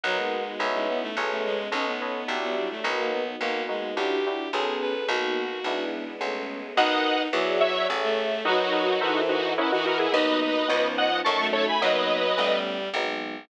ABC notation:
X:1
M:3/4
L:1/16
Q:1/4=107
K:Bmix
V:1 name="Lead 1 (square)"
z12 | z12 | z12 | z12 |
[df]4 z2 [ce]2 z4 | [DF]6 [DF]2 [CE] [DF] [F^A] [EG] | [Bd]2 [Bd]4 [df]2 [ac']2 [Ac] [gb] | [Bd]6 z6 |]
V:2 name="Violin"
F, G,4 G, B, A, z A, G,2 | C B,4 B, =G, A, z ^A, B,2 | ^A,2 G,2 =G4 ^G2 B2 | F6 z6 |
D4 F,4 z A,3 | F,4 E,4 z E,3 | D4 ^E,4 z A,3 | F,4 =G,4 z4 |]
V:3 name="Electric Piano 2"
[^ABdf]4 [Bcde]4 [G=ABc]4 | [ABcd]2 [ABcd]2 [F=G=de]4 [F^AB^d]4 | [^A,B,DF]2 [A,B,DF]2 [=DEF=G]2 [DEFG]2 [B,C^G=A]4 | [^A,B,DF]4 [G,B,=DE]4 [G,=A,B,C]4 |
[F^ABd]4 [FG=de]4 [G=Ace]4 | [F^ABd]2 [FABd]2 [=A_B=ce]4 [^A=Bdf]2 [ABdf]2 | [F,^A,B,D]4 [^E,B,CD]4 [F,=A,CD]4 | [F,^A,B,D]4 [=G,=A,B,C]4 [F,^G,B,D]4 |]
V:4 name="Electric Bass (finger)" clef=bass
B,,,4 B,,,4 B,,,4 | B,,,4 B,,,4 B,,,4 | B,,,4 B,,,4 B,,,4 | B,,,4 B,,,4 B,,,4 |
B,,,4 E,,4 A,,,4 | z12 | D,,4 C,,4 F,,4 | F,,4 A,,,4 G,,,4 |]
V:5 name="String Ensemble 1"
[^A,B,DF]4 [B,CDE]4 [G,=A,B,C]4 | [A,B,CD]4 [F,=G,=DE]4 [F,^A,B,^D]4 | [^A,B,DF]4 [=DEF=G]4 [B,C^G=A]4 | [^A,B,DF]4 [G,B,=DE]4 [G,=A,B,C]4 |
[^ABdf]4 [G=def]4 [G=Ace]4 | [F^ABd]4 [=A_B=ce]4 [^A=Bdf]4 | [^A,B,DF]4 [B,CD^E]4 [=A,CDF]4 | z12 |]